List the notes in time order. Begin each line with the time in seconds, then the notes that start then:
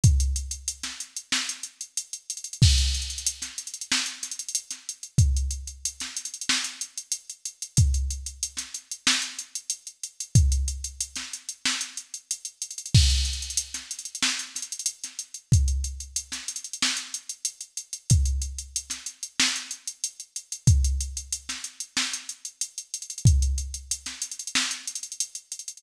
0.04 kick, closed hi-hat
0.20 closed hi-hat
0.36 closed hi-hat
0.51 closed hi-hat
0.68 closed hi-hat
0.83 snare, closed hi-hat
1.00 closed hi-hat
1.17 closed hi-hat
1.32 snare
1.49 closed hi-hat
1.63 closed hi-hat
1.81 closed hi-hat
1.97 closed hi-hat
2.13 closed hi-hat
2.30 closed hi-hat
2.37 closed hi-hat
2.44 closed hi-hat
2.53 closed hi-hat
2.62 kick, crash
2.78 closed hi-hat
2.94 closed hi-hat
3.02 closed hi-hat
3.10 closed hi-hat
3.18 closed hi-hat
3.26 closed hi-hat
3.42 snare, closed hi-hat
3.58 closed hi-hat
3.67 closed hi-hat
3.74 closed hi-hat
3.81 closed hi-hat
3.92 snare
4.06 closed hi-hat
4.23 snare, closed hi-hat
4.31 closed hi-hat
4.39 closed hi-hat
4.49 closed hi-hat
4.55 closed hi-hat
4.71 snare, closed hi-hat
4.89 closed hi-hat
5.03 closed hi-hat
5.18 kick, closed hi-hat
5.37 closed hi-hat
5.51 closed hi-hat
5.67 closed hi-hat
5.85 closed hi-hat
6.00 snare, closed hi-hat
6.17 closed hi-hat
6.25 closed hi-hat
6.34 closed hi-hat
6.41 closed hi-hat
6.49 snare
6.64 closed hi-hat
6.81 closed hi-hat
6.98 closed hi-hat
7.12 closed hi-hat
7.30 closed hi-hat
7.45 closed hi-hat
7.62 closed hi-hat
7.77 kick, closed hi-hat
7.94 closed hi-hat
8.10 closed hi-hat
8.26 closed hi-hat
8.43 closed hi-hat
8.57 snare, closed hi-hat
8.74 closed hi-hat
8.91 closed hi-hat
9.07 snare
9.22 closed hi-hat
9.39 closed hi-hat
9.55 closed hi-hat
9.70 closed hi-hat
9.87 closed hi-hat
10.03 closed hi-hat
10.20 closed hi-hat
10.35 kick, closed hi-hat
10.52 closed hi-hat
10.68 closed hi-hat
10.84 closed hi-hat
11.01 closed hi-hat
11.16 snare, closed hi-hat
11.33 closed hi-hat
11.49 closed hi-hat
11.65 snare
11.81 closed hi-hat
11.97 closed hi-hat
12.14 closed hi-hat
12.31 closed hi-hat
12.45 closed hi-hat
12.62 closed hi-hat
12.71 closed hi-hat
12.78 closed hi-hat
12.86 closed hi-hat
12.94 kick, crash
13.10 closed hi-hat
13.25 closed hi-hat
13.33 closed hi-hat
13.42 closed hi-hat
13.50 closed hi-hat
13.57 closed hi-hat
13.74 snare, closed hi-hat
13.91 closed hi-hat
13.99 closed hi-hat
14.05 closed hi-hat
14.15 closed hi-hat
14.22 snare
14.39 closed hi-hat
14.55 snare, closed hi-hat
14.62 closed hi-hat
14.72 closed hi-hat
14.79 closed hi-hat
14.86 closed hi-hat
15.04 snare, closed hi-hat
15.19 closed hi-hat
15.34 closed hi-hat
15.52 kick, closed hi-hat
15.68 closed hi-hat
15.84 closed hi-hat
16.00 closed hi-hat
16.16 closed hi-hat
16.32 snare, closed hi-hat
16.48 closed hi-hat
16.56 closed hi-hat
16.64 closed hi-hat
16.73 closed hi-hat
16.82 snare
16.97 closed hi-hat
17.14 closed hi-hat
17.29 closed hi-hat
17.45 closed hi-hat
17.61 closed hi-hat
17.77 closed hi-hat
17.93 closed hi-hat
18.10 kick, closed hi-hat
18.25 closed hi-hat
18.42 closed hi-hat
18.58 closed hi-hat
18.76 closed hi-hat
18.90 snare, closed hi-hat
19.06 closed hi-hat
19.23 closed hi-hat
19.40 snare
19.56 closed hi-hat
19.71 closed hi-hat
19.87 closed hi-hat
20.04 closed hi-hat
20.20 closed hi-hat
20.36 closed hi-hat
20.52 closed hi-hat
20.67 kick, closed hi-hat
20.84 closed hi-hat
21.01 closed hi-hat
21.17 closed hi-hat
21.33 closed hi-hat
21.49 snare, closed hi-hat
21.64 closed hi-hat
21.80 closed hi-hat
21.97 snare
22.13 closed hi-hat
22.29 closed hi-hat
22.45 closed hi-hat
22.61 closed hi-hat
22.78 closed hi-hat
22.94 closed hi-hat
23.02 closed hi-hat
23.10 closed hi-hat
23.18 closed hi-hat
23.25 kick, closed hi-hat
23.42 closed hi-hat
23.58 closed hi-hat
23.74 closed hi-hat
23.91 closed hi-hat
24.06 snare, closed hi-hat
24.22 closed hi-hat
24.31 closed hi-hat
24.39 closed hi-hat
24.47 closed hi-hat
24.55 snare
24.71 closed hi-hat
24.87 closed hi-hat
24.95 closed hi-hat
25.03 closed hi-hat
25.12 closed hi-hat
25.20 closed hi-hat
25.35 closed hi-hat
25.52 closed hi-hat
25.59 closed hi-hat
25.68 closed hi-hat
25.77 closed hi-hat